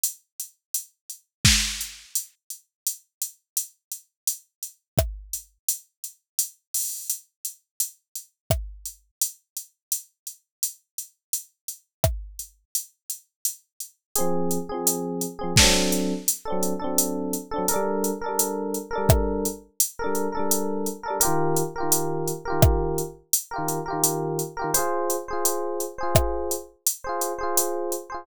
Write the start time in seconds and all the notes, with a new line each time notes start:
0.04 closed hi-hat
0.40 closed hi-hat
0.74 closed hi-hat
1.10 closed hi-hat
1.45 kick, snare
1.81 closed hi-hat
2.15 closed hi-hat
2.50 closed hi-hat
2.87 closed hi-hat
3.22 closed hi-hat
3.57 closed hi-hat
3.92 closed hi-hat
4.27 closed hi-hat
4.63 closed hi-hat
4.98 kick, cross-stick
5.33 closed hi-hat
5.69 closed hi-hat
6.04 closed hi-hat
6.39 closed hi-hat
6.74 open hi-hat
7.10 closed hi-hat
7.45 closed hi-hat
7.80 closed hi-hat
8.15 closed hi-hat
8.50 kick, cross-stick
8.85 closed hi-hat
9.21 closed hi-hat
9.57 closed hi-hat
9.92 closed hi-hat
10.27 closed hi-hat
10.63 closed hi-hat
10.98 closed hi-hat
11.33 closed hi-hat
11.68 closed hi-hat
12.04 kick, cross-stick
12.39 closed hi-hat
12.75 closed hi-hat
13.10 closed hi-hat
13.45 closed hi-hat
13.80 closed hi-hat
14.16 C4 G#4, closed hi-hat
14.20 F3
14.51 closed hi-hat
14.69 C4 G#4
14.74 F3
14.87 closed hi-hat
15.21 closed hi-hat
15.39 C4 G#4
15.44 F3
15.56 D4 A4, kick, snare
15.62 F#3 C4
15.92 closed hi-hat
16.28 closed hi-hat
16.45 D4 A4
16.50 F#3 C4
16.63 closed hi-hat
16.79 D4 A4
16.84 F#3 C4
16.98 closed hi-hat
17.33 closed hi-hat
17.51 D4 A4
17.56 F#3 C4
17.68 A4 A#4, closed hi-hat
17.74 G3 D4
18.04 closed hi-hat
18.21 A4 A#4
18.26 G3 D4
18.39 closed hi-hat
18.74 closed hi-hat
18.91 A4 A#4
18.95 G3 D4
19.09 kick, cross-stick
19.45 closed hi-hat
19.80 closed hi-hat
19.99 A4 A#4
20.04 G3 D4
20.15 closed hi-hat
20.32 A4 A#4
20.37 G3 D4
20.51 closed hi-hat
20.86 closed hi-hat
21.03 A4 A#4
21.08 G3 D4
21.20 G4 A#4, closed hi-hat
21.25 D#3 F4
21.56 closed hi-hat
21.76 G4 A#4
21.80 D#3 F4
21.92 closed hi-hat
22.27 closed hi-hat
22.45 G4 A#4
22.50 D#3 F4
22.62 kick, cross-stick
22.98 closed hi-hat
23.33 closed hi-hat
23.51 G4 A#4
23.56 D#3 F4
23.68 closed hi-hat
23.86 G4 A#4
23.90 D#3 F4
24.04 closed hi-hat
24.39 closed hi-hat
24.57 G4 A#4
24.62 D#3 F4
24.74 G#4 C5, closed hi-hat
24.79 F4
25.10 closed hi-hat
25.28 G#4 C5
25.33 F4
25.45 closed hi-hat
25.80 closed hi-hat
25.98 G#4 C5
26.03 F4
26.15 kick, cross-stick
26.51 closed hi-hat
26.87 closed hi-hat
27.04 G#4 C5
27.09 F4
27.21 closed hi-hat
27.39 G#4 C5
27.43 F4
27.57 closed hi-hat
27.92 closed hi-hat
28.10 G#4 C5
28.14 F4